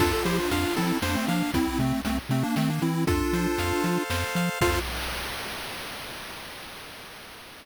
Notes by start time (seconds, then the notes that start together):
0.00 F2 D4 F4 A4, kick, crash
0.13 F4 A4
0.25 F3 E4 G4 C5, closed hi-hat
0.38 D4 F4
0.51 F2 D4 F4 F5, closed hi-hat
0.76 F3 C4 E4 A4, closed hi-hat
1.02 F2 A#3 D4 C5, snare
1.15 A3 C4
1.28 F3 A#3 D4 F5, closed hi-hat
1.54 C2 C4 E4, kick, closed hi-hat
1.79 C3 A3 C4, closed hi-hat
2.05 C2 A3 C4, closed hi-hat
2.29 C3 A3 C4, closed hi-hat
2.43 A#3 D4
2.56 D#3 A3 C4, snare
2.70 A#3 D4
2.82 E3 C4 E4, closed hi-hat
3.07 F2 D4 F4 A4, kick, closed hi-hat
3.33 F3 C5, closed hi-hat
3.58 F2 F5, closed hi-hat
3.84 F3 A4, closed hi-hat
4.10 F2 C5, snare
4.35 F3 F5, closed hi-hat
4.61 F2 F4 A4 C5 F5, kick, crash